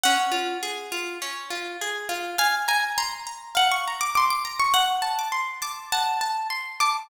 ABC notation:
X:1
M:4/4
L:1/16
Q:1/4=102
K:C#phr
V:1 name="Acoustic Guitar (steel)"
f8 z8 | g2 g2 ^a4 f c'2 d' d' d'2 c' | f3 d'3 d'2 a6 d'2 |]
V:2 name="Acoustic Guitar (steel)"
C2 ^E2 G2 E2 C2 E2 G2 E2 | ^e2 ^a2 ^b2 a2 e2 a2 b2 a2 | z2 a2 =c'2 a2 f2 a2 c'2 a2 |]